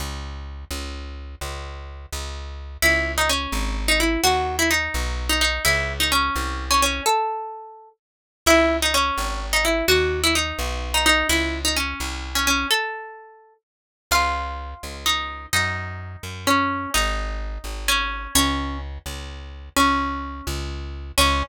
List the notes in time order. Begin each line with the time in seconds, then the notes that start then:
0.00 C#2
0.71 C#2
1.41 C#2
2.13 C#2
2.82 C#2 E4
3.18 D#4
3.29 C#4
3.52 G#1
3.88 D#4
4.00 E4
4.24 D#2 F#4
4.59 E4
4.71 D#4
4.94 B1
5.29 D#4
5.41 D#4
5.65 C#2 E4
6.00 D#4
6.12 C#4
6.36 C2
6.71 C#4
6.82 C#4
7.06 A4
8.46 C#2 E4
8.82 D#4
8.94 C#4
9.18 G#1
9.53 D#4
9.65 E4
9.88 D#2 F#4
10.24 E4
10.35 D#4
10.59 B1
10.94 D#4
11.06 D#4
11.29 C#2 E4
11.65 D#4
11.76 C#4
12.00 C2
12.35 C#4
12.47 C#4
12.71 A4
14.11 C#2 F4
14.83 C#2
15.06 D#4
15.53 F#2 D#4
16.23 F#2
16.47 C#4
16.94 G#1 D#4
17.64 G#1
17.88 C#4
18.35 C#2 C#4
19.06 C#2
19.76 C#2 C#4
20.47 C#2
21.18 C#2 C#4